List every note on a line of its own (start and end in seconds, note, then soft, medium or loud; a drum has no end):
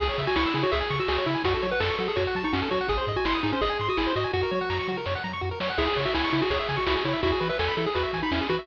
0.00 0.10 C#2 medium
0.00 0.08 G#4 medium
0.00 0.23 G#4 medium
0.00 kick loud
0.00 crash loud
0.09 0.17 C#5 medium
0.18 0.28 C#3 medium
0.18 0.27 E5 medium
0.18 kick loud
0.18 closed hi-hat medium
0.27 0.36 F#4 medium
0.27 0.35 G#5 medium
0.36 0.46 C#2 medium
0.36 0.54 E4 medium
0.36 0.44 C#6 medium
0.36 snare loud
0.46 0.54 E6 medium
0.54 0.64 C#3 medium
0.54 0.63 E4 medium
0.54 0.63 G#4 medium
0.54 closed hi-hat medium
0.63 0.72 F#4 medium
0.63 0.71 C#5 medium
0.71 0.82 C#2 medium
0.71 0.96 G#4 medium
0.71 0.80 E5 medium
0.71 kick loud
0.71 closed hi-hat loud
0.80 0.89 G#5 medium
0.90 1.00 C#3 medium
0.90 0.99 C#6 medium
0.90 kick medium
0.90 closed hi-hat medium
0.99 1.08 F#4 medium
0.99 1.08 E6 medium
1.08 1.18 C#2 medium
1.08 1.26 F#4 medium
1.08 1.17 G#4 medium
1.08 snare loud
1.18 1.26 C#5 medium
1.26 1.36 C#3 medium
1.26 1.43 E4 medium
1.26 1.34 E5 medium
1.26 closed hi-hat medium
1.35 1.43 G#5 medium
1.44 1.55 F#2 medium
1.44 1.67 F#4 medium
1.44 1.53 F#4 medium
1.44 kick loud
1.44 closed hi-hat loud
1.54 1.62 A4 medium
1.62 1.73 F#3 medium
1.62 1.70 C#5 medium
1.62 closed hi-hat medium
1.71 1.80 B4 medium
1.71 1.80 F#5 medium
1.80 1.91 F#2 medium
1.80 1.96 A4 medium
1.80 1.88 A5 medium
1.80 snare loud
1.89 1.98 C#6 medium
1.98 2.09 F#3 medium
1.98 2.08 F#4 medium
1.98 2.07 A4 medium
1.98 closed hi-hat medium
2.08 2.16 G#4 medium
2.08 2.16 A4 medium
2.16 2.27 F#2 medium
2.16 2.43 F#4 medium
2.16 2.24 C#5 medium
2.16 kick loud
2.16 closed hi-hat loud
2.27 2.35 F#5 medium
2.35 2.45 F#3 medium
2.35 2.44 A5 medium
2.35 kick medium
2.35 closed hi-hat medium
2.44 2.53 D#4 medium
2.44 2.53 C#6 medium
2.53 2.63 F#2 medium
2.53 2.69 C#4 medium
2.53 2.61 F#4 medium
2.53 snare loud
2.62 2.70 A4 medium
2.71 2.81 F#3 medium
2.71 2.87 F#4 medium
2.71 2.79 C#5 medium
2.71 kick loud
2.71 closed hi-hat medium
2.81 2.89 F#5 medium
2.88 2.99 G#1 medium
2.88 3.12 G#4 medium
2.88 2.98 G#4 medium
2.88 kick loud
2.88 closed hi-hat loud
2.98 3.06 C5 medium
3.07 3.17 G#2 medium
3.07 3.16 D#5 medium
3.07 kick loud
3.07 closed hi-hat medium
3.16 3.25 F#4 medium
3.16 3.25 G#5 medium
3.25 3.35 G#1 medium
3.25 3.40 E4 medium
3.25 3.34 C6 medium
3.25 snare loud
3.34 3.42 D#6 medium
3.43 3.53 G#2 medium
3.43 3.52 D#4 medium
3.43 3.52 G#4 medium
3.43 closed hi-hat medium
3.52 3.61 C#4 medium
3.52 3.61 C5 medium
3.61 3.71 G#1 medium
3.61 3.88 G#4 loud
3.61 3.70 D#5 medium
3.61 kick loud
3.61 closed hi-hat loud
3.70 3.78 G#5 medium
3.79 3.89 G#2 medium
3.79 3.89 C6 medium
3.79 closed hi-hat medium
3.89 3.97 F#4 medium
3.89 3.98 D#6 medium
3.97 4.08 G#1 medium
3.97 4.13 E4 medium
3.97 4.06 G#4 medium
3.97 snare loud
4.07 4.15 C5 medium
4.16 4.26 G#2 medium
4.16 4.32 F#4 medium
4.16 4.24 D#5 medium
4.16 closed hi-hat medium
4.24 4.32 G#5 medium
4.33 4.44 F#2 medium
4.33 4.41 F#4 medium
4.33 4.98 F#4 medium
4.33 kick medium
4.33 snare medium
4.43 4.51 A#4 medium
4.51 4.61 F#3 medium
4.51 4.59 C#5 medium
4.51 high tom loud
4.61 4.69 F#5 medium
4.70 4.80 F#2 medium
4.70 4.78 A#5 medium
4.70 snare loud
4.79 4.87 C#6 medium
4.88 4.98 F#3 medium
4.88 4.97 F#4 medium
4.88 mid tom loud
4.97 5.05 A#4 medium
5.06 5.16 F#2 medium
5.06 5.14 C#5 medium
5.06 snare loud
5.15 5.23 F#5 medium
5.24 5.34 F#3 medium
5.24 5.32 A#5 medium
5.24 floor tom loud
5.33 5.41 C#6 medium
5.41 5.52 F#2 medium
5.41 5.49 F#4 medium
5.51 5.59 A#4 medium
5.60 5.70 F#3 medium
5.60 5.69 C#5 medium
5.60 snare loud
5.70 5.78 F#5 medium
5.78 5.88 C#2 medium
5.78 5.86 E4 medium
5.78 6.00 G#4 loud
5.78 kick loud
5.78 crash loud
5.87 5.95 G#4 medium
5.96 6.07 C#3 medium
5.96 6.05 C#5 medium
5.96 kick medium
5.96 closed hi-hat medium
6.05 6.14 F#4 medium
6.05 6.13 E5 medium
6.14 6.25 C#2 medium
6.14 6.30 E4 medium
6.14 6.22 G#5 medium
6.14 snare loud
6.24 6.32 C#6 medium
6.33 6.42 C#3 medium
6.33 6.41 E4 medium
6.33 closed hi-hat medium
6.41 6.50 F#4 medium
6.41 6.50 G#4 medium
6.50 6.60 C#2 medium
6.50 6.77 G#4 medium
6.50 6.58 C#5 medium
6.50 kick loud
6.50 closed hi-hat loud
6.59 6.68 E5 medium
6.68 6.79 C#3 medium
6.68 6.77 G#5 medium
6.68 kick loud
6.68 closed hi-hat medium
6.77 6.86 F#4 medium
6.77 6.85 C#6 medium
6.87 6.97 C#2 medium
6.87 6.95 E4 medium
6.87 7.03 F#4 medium
6.87 snare loud
6.95 7.03 G#4 medium
7.05 7.15 C#3 medium
7.05 7.21 E4 medium
7.05 7.13 C#5 medium
7.05 closed hi-hat medium
7.13 7.21 E5 medium
7.23 7.33 E2 medium
7.23 7.31 E4 medium
7.23 7.48 F#4 medium
7.23 kick loud
7.23 closed hi-hat loud
7.32 7.40 G#4 medium
7.40 7.51 E3 medium
7.40 7.48 B4 medium
7.40 closed hi-hat medium
7.49 7.58 B4 medium
7.49 7.57 E5 medium
7.59 7.69 E2 medium
7.59 7.74 A4 medium
7.59 7.67 G#5 medium
7.59 snare loud
7.68 7.76 B5 medium
7.77 7.87 E3 medium
7.77 7.86 E4 medium
7.77 7.85 A4 medium
7.77 closed hi-hat medium
7.86 7.95 G#4 medium
7.95 8.05 E2 medium
7.95 8.20 F#4 medium
7.95 8.03 B4 medium
7.95 kick loud
7.95 closed hi-hat loud
8.03 8.11 E5 medium
8.13 8.23 E3 medium
8.13 8.22 G#5 medium
8.13 kick loud
8.13 closed hi-hat loud
8.23 8.31 D#4 medium
8.23 8.31 B5 medium
8.31 8.41 E2 medium
8.31 8.47 C#4 medium
8.31 8.40 E4 medium
8.31 snare loud
8.41 8.49 G#4 medium
8.49 8.59 E3 medium
8.49 8.67 F#4 loud
8.49 8.57 B4 medium
8.49 kick loud
8.49 closed hi-hat medium
8.59 8.67 E5 medium